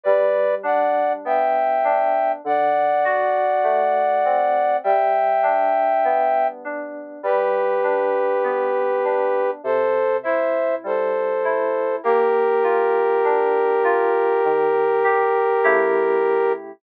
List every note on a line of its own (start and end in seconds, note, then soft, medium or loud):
0.04 2.33 G3 loud
0.04 0.55 B4 medium
0.04 0.55 D5 medium
0.63 1.83 D4 loud
0.63 1.13 D5 medium
0.63 1.13 F#5 medium
1.25 2.39 B3 medium
1.25 2.32 E5 medium
1.25 2.32 G5 medium
1.84 2.41 D4 loud
2.44 4.72 D3 loud
2.44 4.77 D5 medium
2.44 4.77 F#5 medium
3.04 4.75 F#4 medium
3.64 4.78 A3 medium
4.25 4.82 C4 medium
4.84 7.12 G3 loud
4.84 6.47 E5 medium
4.84 6.47 G5 medium
5.43 6.64 D4 medium
6.04 7.19 B3 medium
6.65 7.21 D4 medium
7.23 9.51 G3 loud
7.23 9.51 G4 medium
7.23 9.51 B4 medium
7.83 9.04 D4 medium
8.44 9.58 B3 medium
9.04 9.62 D4 medium
9.63 11.92 C3 loud
9.63 10.17 A4 medium
9.63 10.17 C5 medium
10.23 11.44 E4 medium
10.23 10.75 C5 medium
10.23 10.75 E5 medium
10.84 11.97 G3 loud
10.84 11.96 A4 medium
10.84 11.96 C5 medium
11.44 12.01 E4 medium
12.03 14.33 A#3 loud
12.03 16.52 G4 medium
12.03 16.52 A#4 medium
12.63 13.84 F4 medium
13.24 14.38 D4 medium
13.84 14.41 F4 loud
14.45 15.59 D#3 loud
15.04 15.61 G4 medium
15.64 16.72 C#3 loud
15.64 16.72 A3 loud
15.64 16.72 E4 loud
15.64 16.72 G4 loud